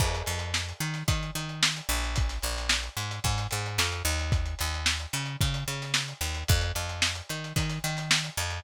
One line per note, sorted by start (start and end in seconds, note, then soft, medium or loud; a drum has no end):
0.00 0.23 F2 medium
0.00 kick medium
0.00 crash medium
0.15 closed hi-hat medium
0.26 0.73 F2 medium
0.26 closed hi-hat medium
0.39 closed hi-hat medium
0.54 snare medium
0.69 closed hi-hat medium
0.80 1.03 D#3 medium
0.80 closed hi-hat medium
0.94 snare soft
0.94 closed hi-hat medium
1.08 1.31 D#3 medium
1.08 kick medium
1.08 closed hi-hat medium
1.23 closed hi-hat medium
1.35 1.81 D#3 medium
1.35 closed hi-hat medium
1.49 closed hi-hat medium
1.63 snare loud
1.76 closed hi-hat medium
1.89 2.39 A#1 loud
1.89 closed hi-hat medium
2.04 closed hi-hat medium
2.16 kick medium
2.16 closed hi-hat medium
2.29 snare soft
2.29 closed hi-hat medium
2.42 2.89 A#1 medium
2.42 closed hi-hat medium
2.57 snare soft
2.57 closed hi-hat medium
2.69 snare medium
2.83 closed hi-hat medium
2.97 3.20 G#2 medium
2.97 closed hi-hat medium
3.11 closed hi-hat medium
3.24 3.47 G#2 medium
3.24 kick medium
3.24 closed hi-hat medium
3.38 snare soft
3.38 closed hi-hat medium
3.51 3.78 G#2 medium
3.51 closed hi-hat medium
3.66 closed hi-hat medium
3.78 4.03 F2 medium
3.78 snare medium
3.92 closed hi-hat medium
4.05 4.55 D#2 loud
4.05 closed hi-hat medium
4.19 closed hi-hat medium
4.32 kick medium
4.32 closed hi-hat medium
4.46 closed hi-hat medium
4.59 5.07 D#2 medium
4.59 snare soft
4.59 closed hi-hat medium
4.74 closed hi-hat medium
4.86 snare medium
5.00 closed hi-hat medium
5.13 5.36 C#3 medium
5.13 snare soft
5.13 closed hi-hat medium
5.26 closed hi-hat medium
5.41 5.64 C#3 medium
5.41 kick medium
5.41 closed hi-hat medium
5.54 closed hi-hat medium
5.68 6.14 C#3 medium
5.68 closed hi-hat medium
5.82 snare soft
5.82 closed hi-hat medium
5.94 snare medium
6.08 closed hi-hat medium
6.21 6.44 D#2 medium
6.21 closed hi-hat medium
6.34 closed hi-hat medium
6.48 6.72 F2 medium
6.48 kick medium
6.48 closed hi-hat medium
6.61 closed hi-hat medium
6.75 7.22 F2 medium
6.75 closed hi-hat medium
6.89 closed hi-hat medium
7.02 snare medium
7.15 closed hi-hat medium
7.29 7.53 D#3 medium
7.29 closed hi-hat medium
7.44 closed hi-hat medium
7.56 7.79 D#3 medium
7.56 kick medium
7.56 closed hi-hat medium
7.69 snare soft
7.69 closed hi-hat medium
7.84 8.30 D#3 medium
7.84 snare soft
7.84 closed hi-hat medium
7.97 snare soft
7.97 closed hi-hat medium
8.11 snare loud
8.24 closed hi-hat medium
8.37 8.60 F2 medium
8.37 snare soft
8.37 closed hi-hat medium
8.50 closed hi-hat medium